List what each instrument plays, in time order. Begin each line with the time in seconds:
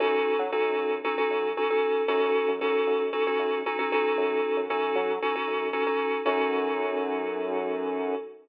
0.00 synth bass 1 F#2, electric piano 2 C#4 D#4 F#4 A4
0.39 synth bass 1 F#3
0.52 synth bass 1 F#2, electric piano 2 C#4 D#4 F#4 A4
0.78 synth bass 1 F#2
1.04 electric piano 2 C#4 D#4 F#4 A4
1.17 electric piano 2 C#4 D#4 F#4 A4
1.30 synth bass 1 F#2
1.57 electric piano 2 C#4 D#4 F#4 A4
1.70 electric piano 2 C#4 D#4 F#4 A4
2.08 synth bass 1 F#2, electric piano 2 C#4 D#4 F#4 A4
2.48 synth bass 1 F#2
2.61 synth bass 1 F#2, electric piano 2 C#4 D#4 F#4 A4
2.87 synth bass 1 F#2
3.13 electric piano 2 C#4 D#4 F#4 A4
3.27 electric piano 2 C#4 D#4 F#4 A4
3.39 synth bass 1 F#2
3.66 electric piano 2 C#4 D#4 F#4 A4
3.79 electric piano 2 C#4 D#4 F#4 A4
3.92 electric piano 2 C#4 D#4 F#4 A4
4.17 synth bass 1 F#2
4.57 synth bass 1 F#2
4.69 synth bass 1 F#2, electric piano 2 C#4 D#4 F#4 A4
4.95 synth bass 1 F#3
5.22 electric piano 2 C#4 D#4 F#4 A4
5.35 electric piano 2 C#4 D#4 F#4 A4
5.48 synth bass 1 F#2
5.73 electric piano 2 C#4 D#4 F#4 A4
5.86 electric piano 2 C#4 D#4 F#4 A4
6.25 synth bass 1 F#2, electric piano 2 C#4 D#4 F#4 A4